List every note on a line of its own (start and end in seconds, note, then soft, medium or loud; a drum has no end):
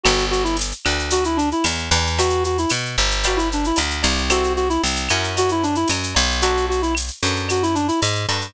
0.03 0.73 G1 loud
0.03 0.25 F#4 medium
0.03 0.43 B4 medium
0.03 0.43 D5 medium
0.03 0.43 F#5 loud
0.03 0.43 G5 loud
0.03 cowbell medium
0.03 claves loud
0.03 shaker medium
0.18 shaker medium
0.31 0.43 F#4 medium
0.31 shaker medium
0.44 0.56 E4 medium
0.44 shaker medium
0.57 tambourine medium
0.57 shaker loud
0.71 shaker medium
0.85 1.53 D2 medium
0.85 1.23 B4 medium
0.85 1.23 D5 medium
0.85 1.23 F#5 medium
0.85 1.23 G5 medium
0.85 claves medium
0.85 shaker medium
0.99 shaker medium
1.10 1.24 F#4 medium
1.10 cowbell medium
1.10 shaker loud
1.24 1.38 E4 medium
1.24 shaker medium
1.37 1.49 D4 loud
1.37 shaker medium
1.51 1.65 E4 medium
1.51 shaker medium
1.64 1.90 E2 medium
1.64 tambourine medium
1.64 cowbell medium
1.64 claves medium
1.64 shaker loud
1.78 shaker medium
1.91 2.66 E2 loud
1.91 2.10 B4 medium
1.91 2.10 D5 medium
1.91 2.10 F#5 medium
1.91 2.10 G5 medium
1.91 cowbell medium
1.91 shaker medium
2.07 shaker medium
2.18 2.43 F#4 loud
2.18 2.56 B4 loud
2.18 2.56 E5 loud
2.18 2.56 G5 medium
2.18 cowbell medium
2.18 shaker loud
2.30 shaker medium
2.44 2.58 F#4 medium
2.44 shaker medium
2.58 2.71 E4 medium
2.58 shaker medium
2.69 2.96 B2 medium
2.69 tambourine medium
2.69 claves medium
2.69 shaker loud
2.85 shaker medium
2.97 3.72 G1 loud
2.97 shaker medium
3.11 shaker medium
3.23 3.39 F#4 medium
3.23 3.62 B4 loud
3.23 3.62 D5 loud
3.23 3.62 F5 loud
3.23 3.62 G5 loud
3.23 cowbell medium
3.23 claves medium
3.23 shaker loud
3.36 3.49 E4 medium
3.36 shaker medium
3.52 3.66 D4 medium
3.52 shaker medium
3.64 3.79 E4 medium
3.64 shaker medium
3.76 4.03 D2 medium
3.76 tambourine medium
3.76 cowbell medium
3.76 shaker loud
3.90 shaker medium
4.03 4.78 C2 loud
4.03 4.22 B4 medium
4.03 4.22 D5 medium
4.03 4.22 F5 medium
4.03 4.22 G5 medium
4.03 cowbell medium
4.03 shaker medium
4.18 shaker medium
4.30 4.67 C4 loud
4.30 4.67 E4 medium
4.30 4.53 F#4 loud
4.30 4.67 G4 loud
4.30 4.67 A4 loud
4.30 cowbell medium
4.30 claves loud
4.30 shaker loud
4.44 shaker medium
4.56 4.69 F#4 medium
4.56 shaker medium
4.69 4.82 E4 loud
4.69 shaker medium
4.84 5.09 C2 medium
4.84 tambourine medium
4.84 shaker loud
4.96 shaker medium
5.08 5.85 F#2 medium
5.08 5.74 C#4 loud
5.08 5.74 E4 medium
5.08 5.74 F#4 medium
5.08 5.74 A#4 medium
5.08 claves medium
5.08 shaker medium
5.24 shaker medium
5.37 5.50 F#4 loud
5.37 cowbell medium
5.37 shaker loud
5.49 5.64 E4 medium
5.49 shaker medium
5.63 5.76 D4 medium
5.63 shaker medium
5.75 5.89 E4 medium
5.75 shaker medium
5.88 6.14 F#2 medium
5.88 tambourine medium
5.88 cowbell medium
5.88 claves medium
5.88 shaker loud
6.03 shaker medium
6.15 7.10 B1 loud
6.15 cowbell medium
6.15 shaker medium
6.31 shaker medium
6.42 6.80 D4 loud
6.42 6.66 F#4 loud
6.42 6.80 F#4 medium
6.42 6.80 A4 medium
6.42 6.80 B4 loud
6.42 cowbell medium
6.42 shaker loud
6.57 shaker medium
6.69 6.81 F#4 medium
6.69 shaker medium
6.82 6.94 E4 medium
6.82 shaker medium
6.95 tambourine medium
6.95 claves medium
6.95 shaker medium
7.08 shaker medium
7.23 7.90 F#2 medium
7.23 7.60 D4 medium
7.23 7.60 F#4 medium
7.23 7.60 A4 medium
7.23 7.60 B4 medium
7.23 shaker medium
7.36 shaker medium
7.48 7.63 F#4 medium
7.48 cowbell medium
7.48 claves medium
7.48 shaker medium
7.62 7.75 E4 medium
7.62 shaker medium
7.75 7.87 D4 medium
7.75 shaker medium
7.88 8.00 E4 medium
7.88 shaker medium
8.01 8.26 G#2 medium
8.01 tambourine medium
8.01 cowbell medium
8.01 shaker medium
8.15 shaker medium
8.28 8.53 G2 medium
8.28 8.47 D4 medium
8.28 8.47 F#4 medium
8.28 8.47 A4 medium
8.28 8.47 B4 medium
8.28 cowbell medium
8.28 shaker medium
8.41 shaker medium